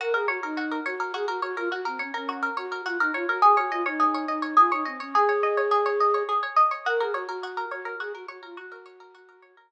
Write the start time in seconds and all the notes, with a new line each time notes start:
0.00 F#4 A#4
0.14 G#4 A#4
0.28 F#4 C#5
0.43 D#4 A#4
0.57 F#4
0.72 A#4
0.86 F#4 C#5
1.00 A#4
1.14 F#4 G#4
1.28 F#4 A#4
1.42 F#4 C#5
1.57 F4 A#4
1.72 F#4
1.85 C4 A#4
1.99 C#4 C#5
2.14 C#4 A#4
2.29 F#4
2.43 A#4
2.57 F#4 C#5
2.72 A#4
2.85 F4 F#4
3.00 D#4 A#4
3.14 F4 C#5
3.29 F#4 A#4
3.42 G#4
3.57 F#4 C#5
3.71 F4 D#5
3.86 D#4 C#5
4.00 G#4
4.14 C#5
4.28 D#4 D#5
4.42 C#5
4.57 F4 G#4
4.72 D#4 C#5
4.85 C4 D#5
5.00 C#4 C#5
5.14 G#4
5.29 C#5
5.43 D#5
5.57 C#5
5.71 G#4
5.86 C#5
6.00 D#5
6.14 C#5
6.29 G#4
6.43 C#5
6.56 D#5
6.71 C#5
6.86 F#4 A#4
7.00 G#4 A#4
7.14 F#4 C#5
7.29 F#4 A#4
7.43 F#4
7.57 A#4
7.71 F#4 C#5
7.85 A#4
8.00 F#4 G#4
8.14 F#4 A#4
8.28 F#4 C#5
8.43 F4 A#4
8.57 F#4
8.72 A#4
8.86 C#5
9.00 A#4
9.15 F#4
9.29 A#4
9.42 C#5
9.57 A#4